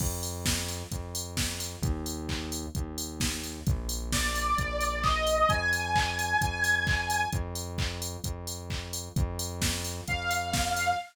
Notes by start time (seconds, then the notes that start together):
0.00 F2, kick, crash
0.23 open hi-hat
0.46 kick, snare
0.69 open hi-hat
0.92 F2, kick, closed hi-hat
1.15 open hi-hat
1.37 kick, snare
1.60 open hi-hat
1.82 D#2, kick, closed hi-hat
2.06 open hi-hat
2.29 kick, clap
2.52 open hi-hat
2.75 D#2, kick, closed hi-hat
2.98 open hi-hat
3.20 kick, snare
3.44 open hi-hat
3.67 A#1, kick, closed hi-hat
3.89 open hi-hat
4.12 D5, kick, snare
4.35 open hi-hat
4.58 A#1, kick, closed hi-hat
4.81 open hi-hat
5.03 D#5, kick, clap
5.27 open hi-hat
5.49 F2 G#5, kick, closed hi-hat
5.73 open hi-hat
5.96 kick, clap
6.19 open hi-hat
6.41 F2, kick, closed hi-hat
6.64 open hi-hat
6.87 kick, clap
7.10 open hi-hat
7.33 F2, kick, closed hi-hat
7.55 open hi-hat
7.78 kick, clap
8.02 open hi-hat
8.24 F2, kick, closed hi-hat
8.47 open hi-hat
8.70 kick, clap
8.93 open hi-hat
9.16 F2, kick, closed hi-hat
9.39 open hi-hat
9.61 kick, snare
9.84 open hi-hat
10.08 F2 F5, kick, closed hi-hat
10.31 open hi-hat
10.53 kick, snare
10.76 open hi-hat